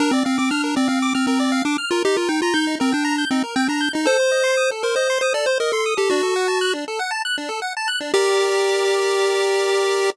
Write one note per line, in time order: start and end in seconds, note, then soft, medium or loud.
0.00 0.11 D4 medium
0.00 0.12 A#4 loud
0.11 0.23 C4 medium
0.11 0.25 D5 medium
0.25 0.38 C4 medium
0.25 0.36 F5 medium
0.38 0.51 C4 medium
0.38 0.49 D6 medium
0.51 0.75 D4 medium
0.51 0.62 F6 loud
0.64 0.75 A#4 medium
0.76 0.88 C4 medium
0.76 0.88 D5 medium
0.88 1.13 C4 medium
0.88 0.99 F5 medium
1.02 1.14 D6 loud
1.15 1.26 C4 medium
1.15 1.26 F6 medium
1.27 1.62 C4 medium
1.27 1.39 A#4 loud
1.40 1.51 D5 loud
1.52 1.63 F5 loud
1.65 1.77 D4 medium
1.65 1.77 D6 medium
1.78 1.90 F6 medium
1.91 2.03 F4 medium
1.91 2.03 A#4 loud
2.05 2.16 D#4 loud
2.05 2.17 G4 medium
2.16 2.29 F4 medium
2.16 2.28 A#4 medium
2.29 2.41 D#4 medium
2.29 2.40 G5 medium
2.42 2.54 F4 medium
2.42 2.54 A#5 loud
2.54 2.75 D#4 medium
2.54 2.65 G6 loud
2.67 2.78 D#4 medium
2.80 2.93 C4 medium
2.80 2.91 A#4 loud
2.92 3.25 D4 medium
2.92 3.04 G5 medium
3.05 3.16 A#5 loud
3.18 3.30 G6 medium
3.31 3.43 C4 medium
3.31 3.43 D#4 medium
3.44 3.55 A#4 medium
3.56 3.68 C4 medium
3.56 3.67 G5 loud
3.68 3.89 D4 medium
3.68 3.81 A#5 medium
3.81 3.92 G6 medium
3.93 4.05 D#4 medium
3.93 4.07 D#4 medium
4.06 4.17 A4 loud
4.06 4.71 C5 loud
4.19 4.31 C5 medium
4.31 4.43 D#5 medium
4.44 4.55 C6 loud
4.57 4.69 D#6 medium
4.71 4.83 A4 medium
4.83 4.95 A#4 medium
4.83 4.95 C5 medium
4.96 5.19 C5 medium
4.96 5.08 D#5 medium
5.10 5.21 C6 loud
5.21 5.33 C5 medium
5.21 5.33 D#6 medium
5.34 5.45 A4 medium
5.34 5.46 D5 medium
5.46 5.58 C5 medium
5.46 5.58 C5 loud
5.60 5.72 A#4 medium
5.60 5.72 D#5 loud
5.72 5.94 A4 medium
5.72 5.84 C6 medium
5.86 5.97 D#6 medium
5.97 6.10 G4 medium
5.97 6.09 A4 loud
6.10 6.22 D4 loud
6.10 6.74 F#4 medium
6.23 6.34 A4 medium
6.36 6.47 F#5 medium
6.48 6.59 A5 medium
6.61 6.73 F#6 loud
6.73 6.85 D4 medium
6.88 6.99 A4 medium
6.99 7.11 F#5 loud
7.11 7.22 A5 loud
7.25 7.36 F#6 loud
7.38 7.49 D4 medium
7.49 7.60 A4 loud
7.62 7.73 F#5 medium
7.77 7.88 A5 loud
7.88 7.99 F#6 loud
8.01 8.12 D4 medium
8.14 10.10 G4 loud
8.14 10.10 A#4 medium
8.14 10.10 D5 medium